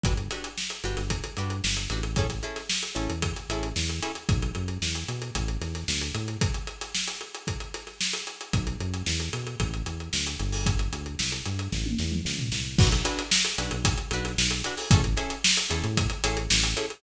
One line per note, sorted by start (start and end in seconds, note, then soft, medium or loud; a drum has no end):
0.03 0.28 G1 medium
0.03 0.14 D4 medium
0.03 0.14 F#4 medium
0.03 0.14 G4 medium
0.03 0.14 B4 medium
0.03 kick loud
0.03 closed hi-hat medium
0.17 closed hi-hat medium
0.30 0.49 D4 medium
0.30 0.49 F#4 medium
0.30 0.49 G4 medium
0.30 0.49 B4 medium
0.30 snare soft
0.30 closed hi-hat medium
0.44 closed hi-hat medium
0.58 snare medium
0.70 closed hi-hat medium
0.84 0.96 G1 medium
0.84 1.03 D4 medium
0.84 1.03 F#4 medium
0.84 1.03 G4 medium
0.84 1.03 B4 medium
0.84 snare soft
0.84 closed hi-hat medium
0.97 1.21 G1 medium
0.97 snare soft
0.97 closed hi-hat medium
1.10 kick medium
1.10 closed hi-hat loud
1.24 closed hi-hat medium
1.37 1.61 G2 medium
1.37 1.56 D4 medium
1.37 1.56 F#4 medium
1.37 1.56 G4 medium
1.37 1.56 B4 medium
1.37 closed hi-hat medium
1.50 closed hi-hat medium
1.63 1.87 G1 medium
1.63 snare loud
1.77 closed hi-hat medium
1.90 2.40 A1 medium
1.90 2.01 D4 medium
1.90 2.01 F#4 medium
1.90 2.01 G4 medium
1.90 2.01 B4 medium
1.90 closed hi-hat medium
2.03 closed hi-hat medium
2.16 2.27 C#4 medium
2.16 2.27 E4 medium
2.16 2.27 G#4 medium
2.16 2.27 A4 medium
2.16 kick loud
2.16 closed hi-hat medium
2.30 snare soft
2.30 closed hi-hat medium
2.43 2.62 C#4 medium
2.43 2.62 E4 medium
2.43 2.62 G#4 medium
2.43 2.62 A4 medium
2.43 closed hi-hat medium
2.56 snare soft
2.56 closed hi-hat medium
2.69 snare loud
2.83 closed hi-hat medium
2.95 3.08 A1 medium
2.95 3.13 C#4 medium
2.95 3.13 E4 medium
2.95 3.13 G#4 medium
2.95 3.13 A4 medium
2.95 closed hi-hat medium
3.10 3.34 E2 medium
3.10 closed hi-hat medium
3.22 kick medium
3.22 closed hi-hat loud
3.36 snare soft
3.36 closed hi-hat medium
3.49 3.73 A1 medium
3.49 3.69 C#4 medium
3.49 3.69 E4 medium
3.49 3.69 G#4 medium
3.49 3.69 A4 medium
3.49 closed hi-hat medium
3.63 closed hi-hat medium
3.76 4.00 E2 medium
3.76 snare loud
3.89 closed hi-hat medium
4.02 4.12 C#4 medium
4.02 4.12 E4 medium
4.02 4.12 G#4 medium
4.02 4.12 A4 medium
4.02 closed hi-hat medium
4.15 closed hi-hat medium
4.29 4.51 B1 medium
4.29 kick loud
4.29 closed hi-hat loud
4.42 closed hi-hat medium
4.55 4.78 F#2 medium
4.55 closed hi-hat medium
4.68 closed hi-hat medium
4.82 5.04 E2 medium
4.82 snare loud
4.95 closed hi-hat medium
5.08 5.31 B2 medium
5.08 closed hi-hat medium
5.22 closed hi-hat medium
5.35 5.58 A1 medium
5.35 kick medium
5.35 closed hi-hat loud
5.48 closed hi-hat medium
5.61 5.84 E2 medium
5.61 snare soft
5.61 closed hi-hat medium
5.75 snare soft
5.75 closed hi-hat medium
5.88 6.11 D2 medium
5.88 snare loud
6.01 closed hi-hat medium
6.14 6.37 A2 medium
6.14 snare soft
6.14 closed hi-hat medium
6.28 closed hi-hat medium
6.41 kick loud
6.41 closed hi-hat loud
6.54 closed hi-hat medium
6.67 closed hi-hat medium
6.81 snare soft
6.81 closed hi-hat medium
6.95 snare loud
7.08 snare soft
7.08 closed hi-hat medium
7.21 closed hi-hat medium
7.35 closed hi-hat medium
7.47 kick medium
7.47 closed hi-hat medium
7.60 closed hi-hat medium
7.74 snare soft
7.74 closed hi-hat medium
7.87 snare soft
7.87 closed hi-hat medium
8.01 snare loud
8.13 closed hi-hat medium
8.27 closed hi-hat medium
8.41 closed hi-hat medium
8.53 8.76 B1 medium
8.53 kick loud
8.53 closed hi-hat loud
8.67 closed hi-hat medium
8.80 9.03 F#2 medium
8.80 closed hi-hat medium
8.94 closed hi-hat medium
9.06 9.29 E2 medium
9.06 snare loud
9.20 closed hi-hat medium
9.33 9.56 B2 medium
9.33 closed hi-hat medium
9.47 closed hi-hat medium
9.60 9.82 A1 medium
9.60 kick medium
9.60 closed hi-hat loud
9.74 closed hi-hat medium
9.86 10.09 E2 medium
9.86 closed hi-hat medium
10.00 closed hi-hat medium
10.13 10.36 D2 medium
10.13 snare loud
10.27 closed hi-hat medium
10.39 10.88 G1 medium
10.39 closed hi-hat medium
10.52 open hi-hat medium
10.66 kick loud
10.66 closed hi-hat loud
10.79 closed hi-hat medium
10.93 11.15 D2 medium
10.93 closed hi-hat medium
11.06 closed hi-hat medium
11.19 11.42 C2 medium
11.19 snare loud
11.32 closed hi-hat medium
11.45 11.68 G2 medium
11.45 snare soft
11.45 closed hi-hat medium
11.59 closed hi-hat medium
11.72 11.95 A1 medium
11.72 kick medium
11.72 snare medium
11.86 high tom medium
11.98 12.21 E2 medium
11.98 snare medium
12.12 mid tom medium
12.25 12.49 C#2 medium
12.25 snare medium
12.39 floor tom loud
12.52 12.76 C2 medium
12.52 snare medium
12.78 13.02 B1 medium
12.78 12.88 D4 medium
12.78 12.88 F#4 loud
12.78 12.88 B4 loud
12.78 kick loud
12.78 crash loud
12.92 closed hi-hat medium
13.05 13.23 D4 medium
13.05 13.23 F#4 medium
13.05 13.23 B4 medium
13.05 closed hi-hat loud
13.19 closed hi-hat medium
13.31 snare loud
13.45 closed hi-hat medium
13.58 13.70 B1 medium
13.58 13.77 D4 medium
13.58 13.77 F#4 medium
13.58 13.77 B4 medium
13.58 closed hi-hat loud
13.71 13.95 B1 medium
13.71 closed hi-hat medium
13.85 kick loud
13.85 closed hi-hat loud
13.98 closed hi-hat medium
14.11 14.35 B1 medium
14.11 14.32 D4 medium
14.11 14.32 F#4 medium
14.11 14.32 B4 medium
14.11 closed hi-hat loud
14.25 snare soft
14.25 closed hi-hat medium
14.38 14.62 B1 medium
14.38 snare loud
14.51 closed hi-hat medium
14.64 14.75 D4 medium
14.64 14.75 F#4 medium
14.64 14.75 B4 medium
14.64 closed hi-hat medium
14.77 open hi-hat medium
14.91 15.15 A1 medium
14.91 15.01 C#4 loud
14.91 15.01 E4 medium
14.91 15.01 G#4 loud
14.91 15.01 A4 loud
14.91 kick loud
14.91 closed hi-hat loud
15.04 closed hi-hat medium
15.17 15.35 C#4 medium
15.17 15.35 E4 medium
15.17 15.35 G#4 medium
15.17 15.35 A4 medium
15.17 closed hi-hat medium
15.30 closed hi-hat medium
15.44 snare loud
15.57 closed hi-hat medium
15.69 15.82 E2 medium
15.69 15.88 C#4 medium
15.69 15.88 E4 medium
15.69 15.88 G#4 medium
15.69 15.88 A4 medium
15.69 closed hi-hat medium
15.84 16.08 A2 medium
15.84 closed hi-hat medium
15.97 kick loud
15.97 closed hi-hat loud
16.10 closed hi-hat medium
16.24 16.48 A1 medium
16.24 16.42 C#4 medium
16.24 16.42 E4 medium
16.24 16.42 G#4 medium
16.24 16.42 A4 medium
16.24 closed hi-hat loud
16.37 closed hi-hat medium
16.50 16.74 A1 medium
16.50 snare loud
16.63 closed hi-hat medium
16.76 16.86 C#4 medium
16.76 16.86 E4 medium
16.76 16.86 G#4 medium
16.76 16.86 A4 loud
16.76 closed hi-hat medium
16.90 closed hi-hat medium